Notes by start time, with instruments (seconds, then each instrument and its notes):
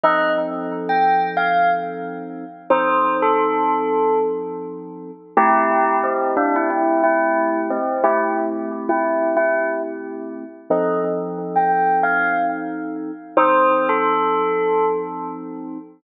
0.03 electric piano 2 F3 C4 D#4 A4, tubular bells D#5
0.89 tubular bells G5
1.37 tubular bells F5
2.70 electric piano 2 F3 C4 D#4 A4, tubular bells C5
3.22 tubular bells A4
5.37 electric piano 2 A3 C4 E4 G4, tubular bells E4 G4
6.03 tubular bells C4
6.37 tubular bells D4
6.56 tubular bells E4
6.70 tubular bells E4
7.04 tubular bells E4
7.70 tubular bells C4
8.03 electric piano 2 A3 C4 E4 G4, tubular bells E4
8.89 tubular bells E4
9.37 tubular bells E4
10.70 electric piano 2 F3 C4 D#4 A4, tubular bells D#5
11.56 tubular bells G5
12.03 tubular bells F5
13.37 electric piano 2 F3 C4 D#4 A4, tubular bells C5
13.89 tubular bells A4